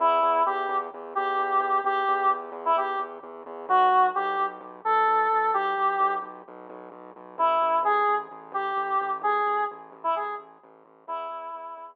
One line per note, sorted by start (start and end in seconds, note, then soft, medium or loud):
0.00 0.19 E2 loud
0.00 0.43 E4 medium
0.22 0.42 E2 loud
0.46 0.66 E2 medium
0.46 0.77 G4 medium
0.69 0.88 E2 loud
0.94 1.13 E2 medium
1.15 1.37 E2 medium
1.15 1.81 G4 medium
1.39 1.58 E2 medium
1.60 1.80 E2 medium
1.84 2.03 E2 medium
1.84 2.30 G4 medium
2.08 2.28 E2 medium
2.30 2.50 E2 medium
2.52 2.72 E2 medium
2.65 2.76 E4 medium
2.76 2.96 E2 medium
2.76 2.99 G4 medium
2.99 3.18 E2 medium
3.23 3.43 E2 medium
3.46 3.66 E2 medium
3.69 3.88 B1 loud
3.69 4.07 F#4 medium
3.92 4.11 B1 medium
4.15 4.36 B1 loud
4.15 4.46 G4 medium
4.39 4.59 B1 medium
4.61 4.80 B1 medium
4.85 5.05 B1 medium
4.85 5.51 A4 medium
5.07 5.27 B1 medium
5.32 5.52 B1 medium
5.54 5.74 B1 medium
5.54 6.14 G4 medium
5.78 5.97 B1 medium
5.99 6.19 B1 medium
6.22 6.42 B1 medium
6.48 6.67 B1 medium
6.70 6.89 B1 medium
6.92 7.11 B1 medium
7.16 7.36 B1 medium
7.38 7.58 A1 loud
7.38 7.79 E4 medium
7.62 7.81 A1 medium
7.83 8.02 A1 medium
7.83 8.15 G#4 medium
8.08 8.28 A1 medium
8.31 8.51 A1 medium
8.52 8.72 A1 medium
8.52 9.10 G4 medium
8.76 8.96 A1 medium
9.01 9.21 A1 medium
9.22 9.41 A1 medium
9.22 9.64 G#4 medium
9.46 9.66 A1 medium
9.71 9.91 A1 medium
9.92 10.12 A1 medium
10.04 10.15 E4 medium
10.15 10.35 A1 medium
10.15 10.35 G#4 medium
10.38 10.58 A1 medium
10.63 10.83 A1 loud
10.85 11.04 A1 medium
11.07 11.27 E2 loud
11.07 11.86 E4 loud
11.30 11.50 E2 medium
11.55 11.74 E2 medium
11.77 11.96 E2 medium